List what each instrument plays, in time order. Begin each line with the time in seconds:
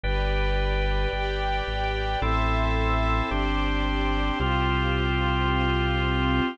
0.03 synth bass 2 G1, pad 2 (warm) G4 B4 D5, drawbar organ B4 D5 G5
1.13 synth bass 2 G1, pad 2 (warm) G4 D5 G5
1.67 synth bass 2 G#1
2.22 synth bass 2 A1, drawbar organ C4 E4 A4, pad 2 (warm) A4 C5 E5
3.31 synth bass 2 G1, drawbar organ C4 D4 G4, pad 2 (warm) G4 C5 D5
4.40 synth bass 2 C2, drawbar organ C4 F4 G4, pad 2 (warm) F4 G4 C5
5.49 pad 2 (warm) C4 F4 C5